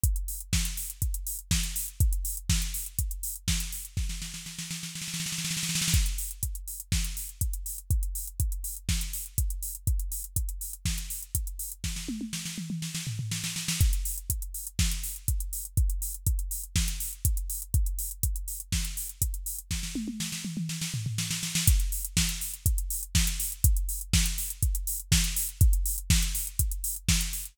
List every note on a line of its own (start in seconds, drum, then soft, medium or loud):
0.03 kick medium
0.03 closed hi-hat loud
0.16 closed hi-hat medium
0.28 open hi-hat medium
0.40 closed hi-hat medium
0.53 kick medium
0.53 snare medium
0.65 closed hi-hat medium
0.77 open hi-hat medium
0.90 closed hi-hat medium
1.02 kick medium
1.02 closed hi-hat medium
1.14 closed hi-hat medium
1.27 open hi-hat medium
1.39 closed hi-hat medium
1.51 kick medium
1.51 snare loud
1.63 closed hi-hat medium
1.76 open hi-hat medium
1.88 closed hi-hat medium
2.00 kick loud
2.00 closed hi-hat medium
2.13 closed hi-hat medium
2.25 open hi-hat medium
2.37 closed hi-hat medium
2.49 kick medium
2.49 snare medium
2.62 closed hi-hat medium
2.74 open hi-hat medium
2.86 closed hi-hat medium
2.99 kick medium
2.99 closed hi-hat medium
3.11 closed hi-hat medium
3.23 open hi-hat medium
3.36 closed hi-hat medium
3.48 kick medium
3.48 snare medium
3.60 closed hi-hat medium
3.72 open hi-hat medium
3.85 closed hi-hat medium
3.97 kick medium
3.97 snare medium
4.09 snare medium
4.22 snare medium
4.34 snare medium
4.46 snare medium
4.59 snare medium
4.71 snare medium
4.83 snare medium
4.95 snare medium
5.02 snare medium
5.08 snare medium
5.14 snare medium
5.20 snare medium
5.26 snare medium
5.32 snare medium
5.38 snare medium
5.45 snare medium
5.51 snare medium
5.57 snare medium
5.63 snare medium
5.69 snare medium
5.75 snare medium
5.82 snare medium
5.88 snare medium
5.94 kick medium
5.94 closed hi-hat medium
6.06 closed hi-hat medium
6.18 open hi-hat medium
6.31 closed hi-hat medium
6.43 kick medium
6.43 closed hi-hat medium
6.55 closed hi-hat medium
6.68 open hi-hat medium
6.80 closed hi-hat medium
6.92 kick medium
6.92 snare medium
7.04 closed hi-hat medium
7.17 open hi-hat medium
7.29 closed hi-hat soft
7.41 kick medium
7.41 closed hi-hat medium
7.53 closed hi-hat medium
7.66 open hi-hat medium
7.78 closed hi-hat medium
7.90 kick medium
7.90 closed hi-hat medium
8.03 closed hi-hat medium
8.15 open hi-hat medium
8.27 closed hi-hat medium
8.40 kick medium
8.40 closed hi-hat medium
8.52 closed hi-hat medium
8.64 open hi-hat medium
8.77 closed hi-hat medium
8.89 kick medium
8.89 snare medium
9.01 closed hi-hat medium
9.13 open hi-hat medium
9.26 closed hi-hat medium
9.38 kick medium
9.38 closed hi-hat medium
9.50 closed hi-hat medium
9.62 open hi-hat medium
9.75 closed hi-hat medium
9.87 kick medium
9.87 closed hi-hat medium
9.99 closed hi-hat medium
10.12 open hi-hat medium
10.24 closed hi-hat medium
10.36 kick medium
10.36 closed hi-hat medium
10.49 closed hi-hat medium
10.61 open hi-hat medium
10.73 closed hi-hat medium
10.85 kick medium
10.85 snare medium
10.98 closed hi-hat medium
11.10 open hi-hat medium
11.22 closed hi-hat medium
11.35 kick medium
11.35 closed hi-hat medium
11.47 closed hi-hat medium
11.59 open hi-hat medium
11.72 closed hi-hat medium
11.84 kick medium
11.84 snare medium
11.96 snare medium
12.09 high tom medium
12.21 high tom medium
12.33 snare medium
12.45 snare medium
12.58 mid tom medium
12.70 mid tom medium
12.82 snare medium
12.95 snare medium
13.07 floor tom medium
13.19 floor tom medium
13.31 snare medium
13.44 snare medium
13.56 snare medium
13.68 snare medium
13.81 kick loud
13.81 closed hi-hat medium
13.93 closed hi-hat medium
14.05 open hi-hat medium
14.18 closed hi-hat medium
14.30 kick medium
14.30 closed hi-hat medium
14.42 closed hi-hat medium
14.54 open hi-hat medium
14.67 closed hi-hat medium
14.79 kick medium
14.79 snare medium
14.91 closed hi-hat medium
15.03 open hi-hat medium
15.16 closed hi-hat medium
15.28 kick medium
15.28 closed hi-hat medium
15.40 closed hi-hat medium
15.53 open hi-hat medium
15.65 closed hi-hat medium
15.77 kick medium
15.77 closed hi-hat medium
15.90 closed hi-hat medium
16.02 open hi-hat medium
16.14 closed hi-hat medium
16.27 kick medium
16.27 closed hi-hat medium
16.39 closed hi-hat medium
16.51 open hi-hat medium
16.63 closed hi-hat medium
16.76 kick medium
16.76 snare medium
16.88 closed hi-hat medium
17.00 open hi-hat medium
17.13 closed hi-hat medium
17.25 kick medium
17.25 closed hi-hat loud
17.37 closed hi-hat medium
17.50 open hi-hat medium
17.62 closed hi-hat medium
17.74 kick medium
17.74 closed hi-hat medium
17.86 closed hi-hat medium
17.99 open hi-hat medium
18.11 closed hi-hat medium
18.23 kick medium
18.23 closed hi-hat loud
18.36 closed hi-hat medium
18.48 open hi-hat medium
18.60 closed hi-hat medium
18.72 kick medium
18.72 snare medium
18.85 closed hi-hat medium
18.97 open hi-hat medium
19.09 closed hi-hat medium
19.22 kick medium
19.22 closed hi-hat loud
19.34 closed hi-hat medium
19.46 open hi-hat medium
19.59 closed hi-hat medium
19.71 kick medium
19.71 snare medium
19.83 snare medium
19.95 high tom medium
20.08 high tom medium
20.20 snare medium
20.32 snare medium
20.45 mid tom medium
20.57 mid tom medium
20.69 snare medium
20.81 snare medium
20.94 floor tom medium
21.06 floor tom medium
21.18 snare medium
21.31 snare medium
21.43 snare medium
21.55 snare loud
21.67 kick loud
21.67 closed hi-hat loud
21.80 closed hi-hat medium
21.92 open hi-hat medium
22.05 closed hi-hat medium
22.17 kick medium
22.17 snare loud
22.29 closed hi-hat medium
22.41 open hi-hat medium
22.54 closed hi-hat medium
22.66 kick medium
22.66 closed hi-hat loud
22.78 closed hi-hat medium
22.90 open hi-hat medium
23.03 closed hi-hat medium
23.15 kick medium
23.15 snare loud
23.27 closed hi-hat medium
23.40 open hi-hat medium
23.52 closed hi-hat medium
23.64 kick loud
23.64 closed hi-hat loud
23.77 closed hi-hat medium
23.89 open hi-hat medium
24.01 closed hi-hat medium
24.13 kick medium
24.13 snare loud
24.26 closed hi-hat medium
24.38 open hi-hat medium
24.50 closed hi-hat medium
24.62 kick medium
24.62 closed hi-hat medium
24.75 closed hi-hat medium
24.87 open hi-hat medium
25.00 closed hi-hat medium
25.12 kick medium
25.12 snare loud
25.24 closed hi-hat medium
25.36 open hi-hat medium
25.49 closed hi-hat medium
25.61 kick loud
25.61 closed hi-hat medium
25.73 closed hi-hat medium
25.86 open hi-hat medium
25.98 closed hi-hat medium
26.10 kick medium
26.10 snare loud
26.23 closed hi-hat medium
26.35 open hi-hat medium
26.47 closed hi-hat medium
26.59 kick medium
26.59 closed hi-hat loud
26.71 closed hi-hat medium
26.84 open hi-hat medium
26.96 closed hi-hat medium
27.09 kick medium
27.09 snare loud
27.21 closed hi-hat medium
27.33 open hi-hat medium
27.45 closed hi-hat medium